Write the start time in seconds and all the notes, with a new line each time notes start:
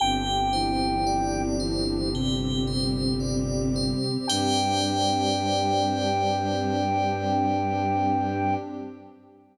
0.00 G1 C4 D4 G4 G5
0.53 E3 E4 C5
1.07 D5
1.60 E3 E4 C5
2.13 C3 G3 C4 G4
2.67 C5
3.20 D5
3.76 C5
4.27 G2 G3 C4 D4 G4 C5 D5 G5